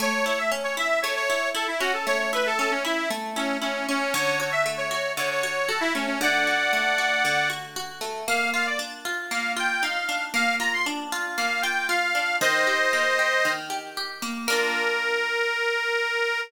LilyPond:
<<
  \new Staff \with { instrumentName = "Accordion" } { \time 4/4 \key a \major \tempo 4 = 116 cis''8 cis''16 e''16 r16 cis''16 e''8 cis''16 cis''8. a'16 e'16 fis'16 a'16 | cis''16 cis''16 b'16 a'16 a'16 cis'16 e'8 r8 cis'8 cis'8 cis'8 | cis''8 cis''16 e''16 r16 cis''16 cis''8 cis''16 cis''8. a'16 e'16 cis'16 cis'16 | <d'' fis''>2~ <d'' fis''>8 r4. |
\key bes \major f''8 f''16 d''16 r4 f''8 g''8 f''4 | f''8 bes''16 c'''16 r4 f''8 g''8 f''4 | <c'' ees''>2~ <c'' ees''>8 r4. | bes'1 | }
  \new Staff \with { instrumentName = "Orchestral Harp" } { \time 4/4 \key a \major a8 e'8 cis'8 e'8 a8 e'8 e'8 cis'8 | a8 e'8 cis'8 e'8 a8 e'8 e'8 cis'8 | d8 fis'8 a8 fis'8 d8 fis'8 fis'8 a8 | d8 fis'8 a8 fis'8 d8 fis'8 fis'8 a8 |
\key bes \major bes8 f'8 d'8 f'8 bes8 f'8 ees'8 d'8 | bes8 f'8 d'8 f'8 bes8 f'8 f'8 d'8 | ees8 g'8 bes8 g'8 ees8 g'8 g'8 bes8 | <bes d' f'>1 | }
>>